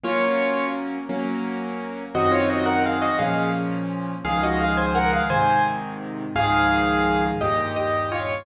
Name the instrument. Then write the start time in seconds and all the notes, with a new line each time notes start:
acoustic grand piano
0.04 F#3 A#3 C#4 F4 C#5
1.09 F#3 A#3 C#4
2.14 F#2 D#3 C4 F#4 D#5
2.32 F4 C#5
2.50 F#4 D#5
2.66 A#4 F#5
2.86 G#4 F5
3.02 F#4 D#5
3.19 A#2 F3 C#4 G#4 F5
4.25 C#2 D#3 F3 G#3 G#4 F5
4.43 F#4 D#5
4.61 G#4 F5
4.77 C5 G#5
4.95 A#4 F#5
5.13 G#4 F5
5.30 G#2 C3 D#3 C5 G#5
6.35 C#2 G#2 D#3 F3 G#4 F5
7.41 D#2 G2 A#2 G4 D#5
7.76 G4 D#5
8.12 F4 C#5